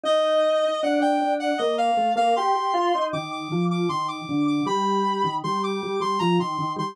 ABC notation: X:1
M:3/4
L:1/16
Q:1/4=78
K:Bb
V:1 name="Clarinet"
e4 ^f g2 f e =f2 f | c'4 d' d'2 d' c' d'2 d' | =b4 c' d'2 c' _b c'2 c' |]
V:2 name="Drawbar Organ"
E4 D D D2 B,2 A, B, | G G F E E,2 F,2 E,2 D,2 | G,3 E, G,2 G, G, F, E, E, G, |]